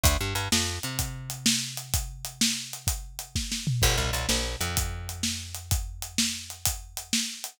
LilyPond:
<<
  \new Staff \with { instrumentName = "Electric Bass (finger)" } { \clef bass \time 12/8 \key d \major \tempo 4. = 127 d,8 g,8 g,8 f,4 c2.~ c8~ | c1. | g,,8 c,8 c,8 ais,,4 f,2.~ f,8~ | f,1. | }
  \new DrumStaff \with { instrumentName = "Drums" } \drummode { \time 12/8 <hh bd>4 hh8 sn4 hh8 <hh bd>4 hh8 sn4 hh8 | <hh bd>4 hh8 sn4 hh8 <hh bd>4 hh8 <bd sn>8 sn8 tomfh8 | <cymc bd>4 hh8 sn4 hh8 <hh bd>4 hh8 sn4 hh8 | <hh bd>4 hh8 sn4 hh8 <hh bd>4 hh8 sn4 hh8 | }
>>